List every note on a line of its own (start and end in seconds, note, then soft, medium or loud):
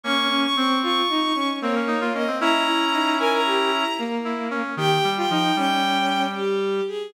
0.03 0.46 A#3 medium
0.03 0.28 C#4 loud
0.03 0.46 C#4 medium
0.03 0.40 C#6 loud
0.30 0.54 C#4 loud
0.43 0.56 C#6 loud
0.56 0.81 C4 loud
0.56 1.02 C4 medium
0.56 0.78 C#6 medium
0.83 1.08 F4 loud
0.83 1.48 C#6 medium
1.09 1.32 D#4 loud
1.35 1.59 C#4 loud
1.62 2.28 A#3 loud
1.62 1.75 C4 medium
1.62 2.04 C#5 medium
1.75 1.88 C#4 medium
1.87 2.00 D#4 medium
2.01 2.13 F4 medium
2.14 2.27 C#4 medium
2.14 2.37 D#5 loud
2.27 2.40 C4 medium
2.40 3.84 C#4 medium
2.40 2.62 E4 loud
2.40 3.84 E4 medium
2.40 3.14 A#5 loud
2.67 2.89 E4 loud
2.93 3.14 D#4 loud
3.19 3.41 A#4 loud
3.19 3.32 G#5 loud
3.33 3.94 A#5 loud
3.46 3.70 G4 loud
3.72 3.97 E4 medium
3.98 4.62 A#3 loud
4.25 4.48 E4 medium
4.50 4.75 C#4 medium
4.77 4.98 D#3 medium
4.77 5.09 G4 loud
4.77 5.09 G5 loud
5.04 5.25 G3 medium
5.17 5.29 F4 loud
5.17 5.29 G5 medium
5.30 5.52 F3 medium
5.30 5.55 D#4 loud
5.30 5.56 G5 loud
5.56 6.81 G3 medium
5.56 6.26 C#4 medium
5.56 6.22 G5 loud
6.35 6.83 G4 loud
6.88 7.10 G#4 loud